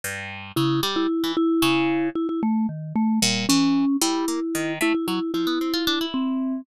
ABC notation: X:1
M:5/8
L:1/16
Q:1/4=113
K:none
V:1 name="Vibraphone"
z4 E2 z E3 | E6 E E A,2 | ^D,2 A,2 G,2 ^C4 | E6 E E E2 |
E6 C4 |]
V:2 name="Orchestral Harp"
G,,4 ^C,2 G,2 z E, | z2 ^C,4 z4 | z4 ^A,,2 E,3 z | G,2 ^A, z ^D,2 =A, z ^F, z |
F, B, C F D E5 |]